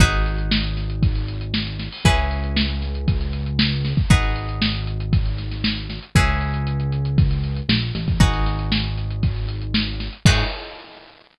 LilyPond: <<
  \new Staff \with { instrumentName = "Acoustic Guitar (steel)" } { \time 4/4 \key gis \minor \tempo 4 = 117 <dis' fis' gis' b'>1 | <cis' e' gis' b'>1 | <dis' fis' gis' b'>1 | <cis' e' gis' b'>1 |
<dis' fis' gis' b'>1 | <dis' fis' gis' b'>4 r2. | }
  \new Staff \with { instrumentName = "Synth Bass 1" } { \clef bass \time 4/4 \key gis \minor gis,,1 | cis,1 | gis,,1 | cis,2. ais,,8 a,,8 |
gis,,1 | gis,4 r2. | }
  \new DrumStaff \with { instrumentName = "Drums" } \drummode { \time 4/4 <hh bd>16 hh16 hh16 hh16 sn16 hh16 <hh sn>16 hh16 <hh bd>16 hh16 hh16 hh16 sn16 <hh sn>16 <hh sn>16 hho16 | <hh bd>16 hh16 hh16 hh16 sn16 hh16 <hh sn>16 hh16 <hh bd>16 hh16 hh16 hh16 sn16 hh16 <hh sn>16 <bd sn>16 | <hh bd>16 hh16 hh16 hh16 sn16 hh16 hh16 hh16 <hh bd>16 hh16 <hh sn>16 <hh sn>16 sn16 hh16 <hh sn>16 hh16 | <hh bd>16 hh16 hh16 hh16 hh16 hh16 hh16 hh16 <hh bd>16 hh16 hh16 hh16 sn16 <hh sn>16 <hh sn>16 <hh bd>16 |
<hh bd>16 <hh sn>16 <hh sn>16 hh16 sn16 hh16 <hh sn>16 hh16 <hh bd>16 hh16 hh16 hh16 sn16 hh16 <hh sn>16 hh16 | <cymc bd>4 r4 r4 r4 | }
>>